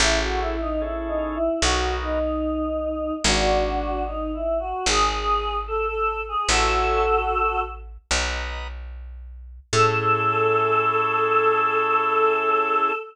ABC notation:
X:1
M:4/4
L:1/16
Q:1/4=74
K:Alyd
V:1 name="Choir Aahs"
E F E D (3E2 D2 E2 F2 D6 | [=DF]4 (3^D2 E2 F2 G4 A A2 G | [FA]6 z10 | A16 |]
V:2 name="Drawbar Organ"
[CEGA]4 [CEGA]4 [B,DF^A]8 | z16 | [cega]8 [Bdf^a]8 | [CEGA]16 |]
V:3 name="Electric Bass (finger)" clef=bass
A,,,8 B,,,8 | G,,,8 G,,,8 | A,,,8 B,,,8 | A,,16 |]